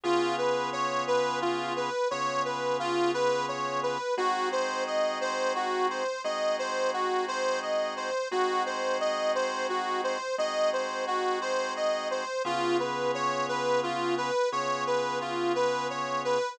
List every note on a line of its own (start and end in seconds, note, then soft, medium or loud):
0.03 1.90 C#3 medium
0.03 1.90 B3 loud
0.03 1.90 F4 loud
0.03 0.35 F4 medium
0.03 1.90 G#4 loud
0.38 0.70 B4 medium
0.73 1.04 C#5 medium
1.07 1.39 B4 medium
1.42 1.73 F4 medium
1.76 2.08 B4 medium
2.11 3.97 C#3 medium
2.11 3.97 B3 medium
2.11 3.97 F4 medium
2.11 3.97 G#4 medium
2.11 2.42 C#5 medium
2.45 2.77 B4 medium
2.79 3.11 F4 medium
3.14 3.46 B4 medium
3.48 3.80 C#5 medium
3.83 4.15 B4 medium
4.17 6.04 G#3 medium
4.17 6.04 C4 loud
4.17 6.04 D#4 loud
4.17 4.49 F#4 medium
4.17 6.04 F#4 medium
4.52 4.84 C5 medium
4.87 5.18 D#5 medium
5.21 5.53 C5 medium
5.55 5.87 F#4 medium
5.90 6.22 C5 medium
6.24 8.10 G#3 medium
6.24 8.10 C4 medium
6.24 8.10 D#4 medium
6.24 8.10 F#4 medium
6.24 6.56 D#5 medium
6.59 6.91 C5 medium
6.93 7.25 F#4 medium
7.28 7.60 C5 medium
7.62 7.94 D#5 medium
7.97 8.28 C5 medium
8.31 10.18 G#3 loud
8.31 10.18 C4 loud
8.31 10.18 D#4 medium
8.31 8.63 F#4 medium
8.31 10.18 F#4 loud
8.66 8.98 C5 medium
9.00 9.32 D#5 medium
9.35 9.67 C5 medium
9.69 10.01 F#4 medium
10.04 10.36 C5 medium
10.38 12.24 G#3 medium
10.38 12.24 C4 medium
10.38 12.24 D#4 medium
10.38 12.24 F#4 medium
10.38 10.70 D#5 medium
10.73 11.05 C5 medium
11.07 11.39 F#4 medium
11.41 11.73 C5 medium
11.76 12.08 D#5 medium
12.11 12.42 C5 medium
12.45 14.31 C#3 loud
12.45 14.31 B3 loud
12.45 14.31 F4 medium
12.45 12.77 F4 medium
12.45 14.31 G#4 loud
12.79 13.11 B4 medium
13.14 13.46 C#5 medium
13.49 13.80 B4 medium
13.83 14.15 F4 medium
14.17 14.49 B4 medium
14.52 16.38 C#3 medium
14.52 16.38 B3 medium
14.52 16.38 F4 medium
14.52 16.38 G#4 loud
14.52 14.84 C#5 medium
14.87 15.18 B4 medium
15.21 15.53 F4 medium
15.55 15.87 B4 medium
15.90 16.22 C#5 medium
16.25 16.56 B4 medium